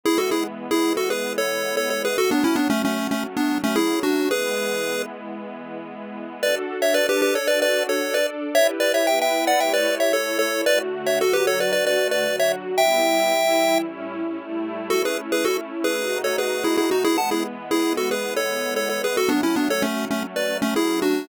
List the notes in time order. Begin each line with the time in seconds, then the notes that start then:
0.03 E3 G#3 B3 E4 G#4
0.18 F#4 A4
0.31 E4 G#4
0.71 E4 G#4
0.97 F#4 A4
1.10 G#4 B4
1.38 A4 C#5
1.77 A4 C#5
1.90 A4 C#5
2.05 G#4 B4
2.17 F#3 A3 C#4 F#4 A4
2.31 B3 D4
2.44 C#4 E4
2.56 B3 D4
2.70 A3 C#4
2.85 A3 C#4
3.11 A3 C#4
3.37 B3 D4
3.64 A3 C#4
3.76 E4 G#4
4.03 D4 F#4
4.31 E3 G#3 B3 G#4 B4
6.43 D4 F#4 A4 B4 D5
6.82 C#5 E5
6.94 D4 A4 B4 D5
7.09 G4 B4
7.22 G4 B4
7.35 A4 C#5
7.47 D4 F#4 A4 B4 D5
7.62 B4 D5
7.89 A4 C#5
8.01 D4 A4 D5
8.14 B4 D5
8.55 E4 G4 B4 C#5 E5
8.80 B4 D5
8.94 C#5 E5
9.07 B3 E4 B4 E5 G5
9.21 E5 G5
9.47 D5 F#5
9.60 A3 E4 G4 C#5 E5 G5
9.73 B4 D5
10.00 C#5 E5
10.12 A3 E4 A4 C#5
10.39 A4 C#5
10.65 D3 A3 F#4 B4 D5
11.06 C#5 E5
11.21 D3 F#3 F#4 A4
11.33 G4 B4
11.47 A4 C#5
11.60 B4 D5
11.72 D3 A3 F#4 B4 D5
11.87 B4 D5
12.11 B4 D5
12.26 D3 F#3 F#4
12.39 C#5 E5
12.78 G3 B3 E4 E5 G5
13.32 E3 G3 E4
13.84 A2 G3 C#4 E4
14.38 A2 G3 A3 E4
14.90 A3 C#4 E4 F#4 A4
15.05 G#4 B4
15.32 G#4 B4
15.45 F#4 A4
15.84 G#4 B4
15.97 B2 A3 D#4 F#4
16.24 A4 C#5
16.38 G#4 B4
16.64 E4 G#4
16.77 E4 G#4
16.91 D#4 F#4
17.04 E3 G#3 B3 E4 G#4
17.18 F#5 A5
17.31 E4 G#4
17.71 E4 G#4
17.97 F#4 A4
18.11 G#4 B4
18.36 A4 C#5
18.76 A4 C#5
18.89 A4 C#5
19.04 G#4 B4
19.16 F#3 A3 C#4 F#4 A4
19.29 B3 D4
19.43 C#4 E4
19.56 B3 D4
19.70 A4 C#5
19.82 A3 C#4
20.11 A3 C#4
20.36 B4 D5
20.62 A3 C#4
20.76 E4 G#4
21.02 D4 F#4